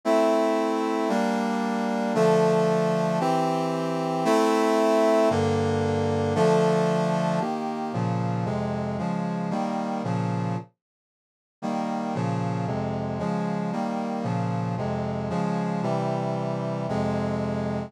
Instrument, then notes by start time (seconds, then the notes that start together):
brass section
0.05 A3 C4 E4
1.09 G3 A#3 D4
2.14 D3 F3 A3
3.20 E3 C4 G4
4.25 A3 C4 E4
5.30 G2 D3 A#3
6.35 D3 F3 A3
7.40 D#3 A#3 G4
7.93 A#2 C#3 F3
8.45 F2 C3 G#3
8.98 C#3 F3 G#3
9.50 D#3 G3 A#3
10.04 A#2 C#3 F3
11.62 D#3 G3 A#3
12.14 A#2 C#3 F3
12.67 F2 C3 G#3
13.19 C#3 F3 G#3
13.72 D#3 G3 A#3
14.23 A#2 C#3 F3
14.77 F2 C3 G#3
15.30 C#3 F3 G#3
15.82 C3 E3 G3
16.89 F2 C3 G#3